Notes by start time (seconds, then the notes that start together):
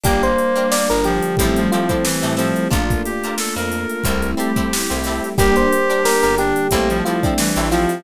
0.03 G1 G3 A#3 D4 G4 A#4, kick, closed hi-hat
0.23 C5, closed hi-hat
0.38 closed hi-hat
0.56 D4 G4 A#4, closed hi-hat
0.72 D3 G3 D4 D5, snare
0.89 G1 A#4, snare, closed hi-hat
1.04 F3 G4, closed hi-hat
1.23 closed hi-hat
1.37 A1 F3 G3 A3 C4 E4, kick, closed hi-hat
1.41 G4 A4
1.56 F3, closed hi-hat
1.72 F3 C4 E4 F4 G4 A4, closed hi-hat
1.89 C4 E4 G4 A4, kick, closed hi-hat
2.05 E3 G3 A3 E4 G4, snare
2.22 A2 C4 E4 G4 A4, closed hi-hat
2.37 F3 C4 E4 G4 A4, snare, closed hi-hat
2.56 closed hi-hat
2.71 A#1 A3 A#3 D4 F4 A4 A#4, kick, closed hi-hat
2.90 kick, closed hi-hat
3.05 G4, snare, closed hi-hat
3.24 D4 F4 A4 A#4, closed hi-hat
3.38 A3 A#3 F4 A4, snare
3.56 F2 A#4, closed hi-hat
3.72 closed hi-hat
3.89 closed hi-hat
4.04 C2 G3 A3 C4 E4 G4 A4, kick, closed hi-hat
4.22 closed hi-hat
4.37 C4 E4 G4 A4, closed hi-hat
4.56 C4 E4 G4 A4, kick, closed hi-hat
4.71 G3 A3 E4 G4, snare
4.90 C2 C4 E4 G4 A4, closed hi-hat
5.04 C4 E4 G4 A4, snare, closed hi-hat
5.24 closed hi-hat
5.38 G1 G3 A#3 D4 G4 A#4, kick, closed hi-hat
5.56 C5, closed hi-hat
5.73 closed hi-hat
5.90 D4 G4 A#4, closed hi-hat
6.05 D3 G3 D4 A#4, snare
6.23 G1 A#4, closed hi-hat
6.38 D4 G4, closed hi-hat
6.56 closed hi-hat
6.71 A1 G3 A3 A#3 C4 E4 G4 A4, kick, closed hi-hat
6.90 F3, closed hi-hat
7.05 F3 C4 E4 F4 G4 A4, closed hi-hat
7.23 C4 D4 E4 G4 A4, kick, closed hi-hat
7.38 E3 G3 A3 E4 G4, snare
7.56 A1 C4 E4 G4 A4, closed hi-hat
7.71 F3 C4 E4 F4 G4 A4, snare, closed hi-hat
7.89 snare, closed hi-hat